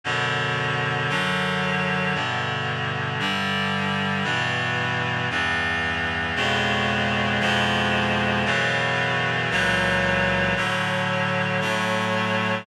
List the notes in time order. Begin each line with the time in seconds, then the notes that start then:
0.04 F#2 B2 D3
1.09 F#2 D3 F#3
2.14 G2 B2 D3
3.19 G2 D3 G3
4.24 G2 B2 E3
5.30 E2 G2 E3
6.36 F2 B2 C#3 G#3
7.40 F2 B2 F3 G#3
8.45 F#2 B2 C#3 E3
9.50 C#2 A#2 E3 F#3
10.56 A2 D3 F#3
11.61 A2 F#3 A3